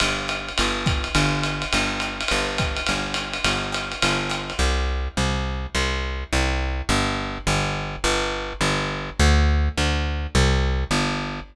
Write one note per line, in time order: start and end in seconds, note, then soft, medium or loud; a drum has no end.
0.00 0.50 G1 medium
0.00 ride loud
0.28 hi-hat pedal medium
0.28 ride loud
0.48 ride medium
0.58 1.08 G1 medium
0.58 ride loud
0.86 kick medium
0.86 hi-hat pedal loud
0.86 ride loud
1.04 ride medium
1.15 1.64 G1 medium
1.15 ride loud
1.43 hi-hat pedal medium
1.43 ride loud
1.62 ride medium
1.73 2.23 G1 medium
1.73 ride loud
2.00 hi-hat pedal loud
2.00 ride medium
2.21 ride loud
2.28 2.81 G1 medium
2.28 ride loud
2.58 kick medium
2.58 hi-hat pedal loud
2.58 ride loud
2.76 ride medium
2.86 3.38 G1 medium
2.86 ride loud
3.14 hi-hat pedal loud
3.14 ride loud
3.33 ride loud
3.44 3.94 G1 medium
3.44 ride loud
3.72 hi-hat pedal loud
3.72 ride loud
3.92 ride medium
4.02 4.52 G1 medium
4.02 ride loud
4.30 hi-hat pedal loud
4.30 ride loud
4.50 ride medium
4.59 5.08 C2 medium
5.17 5.67 C2 medium
5.75 6.24 C2 medium
6.33 6.82 C2 medium
6.89 7.38 G1 loud
7.47 7.96 G1 medium
8.04 8.53 G1 loud
8.61 9.10 G1 medium
9.19 9.69 D2 loud
9.77 10.27 D2 medium
10.35 10.84 C2 loud
10.91 11.40 G1 medium